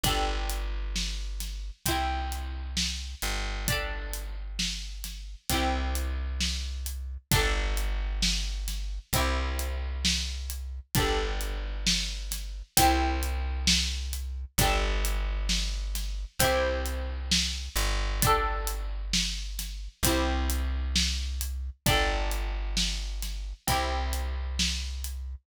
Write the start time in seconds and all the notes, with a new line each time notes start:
0.03 G1 D4 G4, kick, closed hi-hat
0.08 A4
0.49 closed hi-hat
0.96 snare
1.40 snare, closed hi-hat
1.86 C2 C4 E4, kick, closed hi-hat
1.91 G4
2.32 closed hi-hat
2.77 snare
3.22 G1, closed hi-hat
3.68 D4 G4, kick, closed hi-hat
3.72 A4
4.13 closed hi-hat
4.59 snare
5.04 snare, closed hi-hat
5.49 C2 C4 E4, kick, closed hi-hat
5.54 G4
5.95 closed hi-hat
6.41 snare
6.86 closed hi-hat
7.31 G1 D4 G4, kick, closed hi-hat
7.36 A4
7.77 closed hi-hat
8.22 snare
8.68 snare, closed hi-hat
9.13 C2 C4 E4, kick, closed hi-hat
9.18 G4
9.59 closed hi-hat
10.05 snare
10.50 closed hi-hat
10.95 G1 D4 G4, kick, closed hi-hat
10.99 A4
11.41 closed hi-hat
11.87 snare
12.31 snare, closed hi-hat
12.77 C2 C4 E4, kick, closed hi-hat
12.81 G4
13.23 closed hi-hat
13.67 snare
14.13 closed hi-hat
14.58 G1 D4 G4, kick, closed hi-hat
14.63 A4
15.05 closed hi-hat
15.49 snare
15.95 snare, closed hi-hat
16.39 C2 C4 E4, kick, closed hi-hat
16.44 G4
16.86 closed hi-hat
17.31 snare
17.76 G1, closed hi-hat
18.22 D4 G4, kick, closed hi-hat
18.27 A4
18.67 closed hi-hat
19.13 snare
19.59 snare, closed hi-hat
20.03 C2 C4 E4, kick, closed hi-hat
20.09 G4
20.50 closed hi-hat
20.95 snare
21.41 closed hi-hat
21.86 G1 D4 G4, kick, closed hi-hat
21.90 A4
22.31 closed hi-hat
22.77 snare
23.22 snare, closed hi-hat
23.67 C2 C4 E4, kick, closed hi-hat
23.72 G4
24.13 closed hi-hat
24.59 snare
25.04 closed hi-hat